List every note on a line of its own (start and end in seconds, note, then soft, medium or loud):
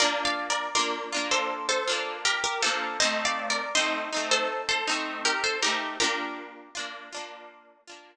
0.00 0.69 D4 medium
0.00 0.69 F4 medium
0.00 0.24 A#4 medium
0.00 0.24 D5 loud
0.04 0.69 A#3 medium
0.25 0.49 D5 medium
0.25 0.49 F5 medium
0.50 0.74 A#4 medium
0.50 0.74 D5 medium
0.75 1.10 D4 medium
0.75 1.10 F4 medium
0.75 1.26 A#4 medium
0.75 1.26 D5 medium
0.79 1.10 A#3 medium
1.12 1.82 D4 medium
1.12 1.82 F4 medium
1.17 1.82 A#3 medium
1.31 1.67 A4 medium
1.31 1.67 C5 medium
1.69 2.14 A4 medium
1.69 2.14 C5 medium
1.88 2.57 D4 medium
1.88 2.57 F4 medium
1.92 2.57 A#3 medium
2.25 2.43 G4 medium
2.25 2.43 A#4 loud
2.44 2.62 G4 medium
2.44 2.62 A#4 medium
2.62 2.97 A#3 medium
2.62 2.97 D4 medium
2.62 2.97 F4 medium
2.62 2.99 A4 medium
2.62 2.99 C5 loud
3.00 3.69 C4 loud
3.00 3.69 D#4 medium
3.00 3.24 C5 loud
3.00 3.24 D#5 loud
3.04 3.69 A3 loud
3.25 3.49 D5 medium
3.25 3.49 F5 medium
3.50 3.74 A#4 medium
3.50 3.74 D5 medium
3.75 4.10 C4 medium
3.75 4.10 D#4 medium
3.75 4.29 C5 medium
3.75 4.29 D#5 loud
3.79 4.10 A3 medium
4.12 4.82 C4 medium
4.12 4.82 D#4 medium
4.17 4.82 A3 medium
4.31 4.62 A4 medium
4.31 4.62 C5 loud
4.69 5.19 A4 medium
4.69 5.19 C5 medium
4.88 5.56 A3 medium
4.88 5.56 C4 medium
4.88 5.56 D#4 medium
5.25 5.43 G4 medium
5.25 5.43 A#4 medium
5.44 5.62 A4 medium
5.44 5.62 C5 loud
5.62 5.97 A3 medium
5.62 5.97 C4 medium
5.62 5.97 D#4 medium
5.62 5.96 G4 medium
5.62 5.96 A#4 medium
6.00 6.69 A#3 loud
6.00 6.69 D4 medium
6.00 6.69 F4 medium
6.00 7.56 G4 medium
6.00 7.56 A#4 loud
6.75 7.10 D4 medium
6.75 7.10 F4 medium
6.79 7.10 A#3 medium
7.12 7.82 D4 medium
7.12 7.82 F4 medium
7.17 7.82 A#3 medium
7.88 8.16 A#3 medium
7.88 8.16 D4 medium
7.88 8.16 F4 medium